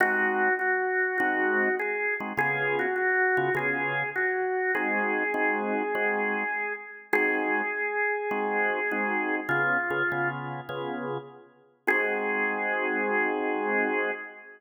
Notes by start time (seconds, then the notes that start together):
0.00 G#3 C4 D#4 F#4
0.59 F#4
1.18 G#3 C4 D#4 F#4
1.79 G#4
2.20 G#3 C4 D#4 F#4
2.37 C#3 B3 F4 G#4
2.79 F#4
2.96 F#4
3.37 C#3 B3 F4 G#4
3.55 C#3 B3 F4 G#4
4.16 F#4
4.75 G#3 C4 D#4 F#4 G#4
5.34 G#3 C4 D#4 F#4
5.95 G#3 C4 D#4 F#4
7.13 G#3 C4 D#4 F#4 G#4
8.31 G#3 C4 D#4 F#4
8.91 G#3 C4 D#4 F#4
9.49 C#3 B3 F4 G#4
9.90 C#3 B3 F4 G#4
10.12 C#3 B3 F4 G#4
10.69 C#3 B3 F4 G#4
11.87 G#3 C4 D#4 F#4 G#4